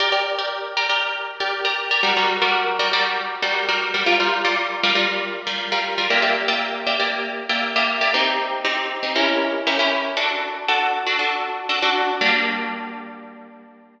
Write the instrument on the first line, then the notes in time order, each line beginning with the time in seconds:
orchestral harp
0.00 G4 A#4 D5
0.12 G4 A#4 D5
0.39 G4 A#4 D5
0.77 G4 A#4 D5
0.89 G4 A#4 D5
1.40 G4 A#4 D5
1.65 G4 A#4 D5
1.91 G4 A#4 D5
2.03 G3 F#4 A#4 D5
2.17 G3 F#4 A#4 D5
2.42 G3 F#4 A#4 D5
2.79 G3 F#4 A#4 D5
2.93 G3 F#4 A#4 D5
3.42 G3 F#4 A#4 D5
3.69 G3 F#4 A#4 D5
3.94 G3 F#4 A#4 D5
4.06 G3 F4 A#4 D5
4.20 G3 F4 A#4 D5
4.45 G3 F4 A#4 D5
4.83 G3 F4 A#4 D5
4.95 G3 F4 A#4 D5
5.47 G3 F4 A#4 D5
5.72 G3 F4 A#4 D5
5.98 G3 F4 A#4 D5
6.10 A#3 G4 D5 E5
6.22 A#3 G4 D5 E5
6.48 A#3 G4 D5 E5
6.87 A#3 G4 D5 E5
6.99 A#3 G4 D5 E5
7.49 A#3 G4 D5 E5
7.76 A#3 G4 D5 E5
8.01 A#3 G4 D5 E5
8.14 C4 D#4 G4
8.65 C4 D#4 G4
9.03 C4 D#4 G4
9.16 C#4 E4 G4 A#4
9.67 C#4 E4 G4 A#4
9.79 C#4 E4 G4 A#4
10.17 D4 F#4 A4
10.68 D4 F#4 A4
11.06 D4 F#4 A4
11.19 D4 F#4 A4
11.69 D4 F#4 A4
11.82 D4 F#4 A4
12.21 G3 A#3 D4